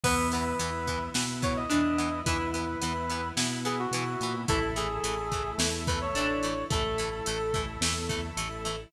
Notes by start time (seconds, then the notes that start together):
0.03 E2 E3 B3 E4 B4, kick, crash
0.32 E3 B3 B4, closed hi-hat
0.59 E2 E3 B3 E4, closed hi-hat
0.87 E3 B3, kick, closed hi-hat
1.14 B2 E3 B3 E4, snare
1.42 E3 B3 C#5, kick, closed hi-hat
1.56 D#5
1.69 E2 E3 B3 D4 E4, closed hi-hat
1.98 E3 B3, closed hi-hat
2.25 E2 E3 B3 E4 B4, kick, closed hi-hat
2.54 E3 B3 B4, closed hi-hat
2.81 E2 E3 B3 E4, closed hi-hat
3.09 E3 B3, closed hi-hat
3.36 B2 E3 B3 E4, snare
3.65 E3 B3 G#4, closed hi-hat
3.79 F#4
3.91 B2 E3 B3 E4, closed hi-hat
4.20 A#2 E3 B3, closed hi-hat
4.48 A1 E3 A3 E4 A4, kick, closed hi-hat
4.76 E3 A3 G#4, closed hi-hat
5.03 A1 E3 A3, closed hi-hat
5.32 E3 A3, kick, closed hi-hat
5.58 E2 E3 A3, snare
5.87 E3 A3 B4, kick, closed hi-hat
6.01 C#5
6.14 A1 E3 A3 D4, closed hi-hat
6.43 E3 A3, closed hi-hat
6.70 A1 E3 A3 E4 A4, kick, closed hi-hat
6.98 E3 A3, closed hi-hat
7.26 A1 E3 A3, closed hi-hat
7.54 E3 A3, kick, closed hi-hat
7.81 E2 E3 A3, snare
8.09 E3 A3, kick, closed hi-hat
8.37 A1 E3 A3, closed hi-hat
8.65 E3 A3, closed hi-hat